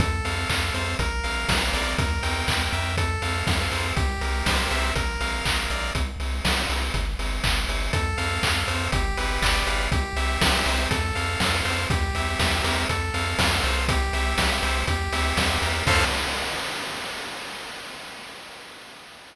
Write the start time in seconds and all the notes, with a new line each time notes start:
0.00 F2 A4, kick, closed hi-hat
0.25 F2 F5, open hi-hat
0.49 F2 A4, kick, clap
0.74 F2 C5, open hi-hat
0.99 A#1 A#4, kick, closed hi-hat
1.24 A#1 F5, open hi-hat
1.48 A#1 A#4, kick, snare
1.73 A#1 D5, open hi-hat
1.98 E2 A#4, kick, closed hi-hat
2.23 E2 G5, open hi-hat
2.48 E2 A#4, kick, clap
2.73 F2 E5, open hi-hat
2.97 A4, kick, closed hi-hat
3.22 F2 F5, open hi-hat
3.47 F2 A4, kick, snare
3.72 F2 C5, open hi-hat
3.96 C2 G4, kick, closed hi-hat
4.21 C2 A#4, open hi-hat
4.46 C2 C5, kick, snare
4.71 C2 E5, open hi-hat
4.95 A#1 A#4, kick, closed hi-hat
5.20 A#1 F5, open hi-hat
5.45 A#1 A#4, kick, clap
5.70 A#1 D5, open hi-hat
5.95 C2, kick, closed hi-hat
6.20 C2, open hi-hat
6.45 C2, kick, snare
6.69 C2, open hi-hat
6.94 G1, kick, closed hi-hat
7.19 G1, open hi-hat
7.44 G1, kick, clap
7.69 G1, open hi-hat
7.93 F2 A4, kick, closed hi-hat
8.17 F2 F5, open hi-hat
8.43 F2 A4, kick, clap
8.68 F2 C5, open hi-hat
8.92 G1 G4, kick, closed hi-hat
9.17 G1 B4, open hi-hat
9.42 G1 D5, kick, clap
9.67 G1 F5, open hi-hat
9.92 C2 G4, kick, closed hi-hat
10.16 C2 E5, open hi-hat
10.41 C2 G4, kick, snare
10.66 C2 C5, open hi-hat
10.91 F2 A4, kick, closed hi-hat
11.15 F2 F5, open hi-hat
11.40 F2 A4, kick, snare
11.65 F2 C5, open hi-hat
11.90 E2 G4, kick, closed hi-hat
12.15 E2 E5, open hi-hat
12.39 E2 G4, kick, snare
12.64 E2 A#4, open hi-hat
12.89 F2 A4, kick, closed hi-hat
13.14 F2 F5, open hi-hat
13.38 F2 A4, kick, snare
13.63 C2 C5, open hi-hat
13.88 G4, kick, closed hi-hat
14.13 C2 E5, open hi-hat
14.37 C2 G4, kick, snare
14.63 C2 C5, open hi-hat
14.87 E2 G4, kick, closed hi-hat
15.12 D2 E5, open hi-hat
15.37 E2 G4, kick, snare
15.62 E2 A#4, open hi-hat
15.87 F2 A4 C5 F5, kick, crash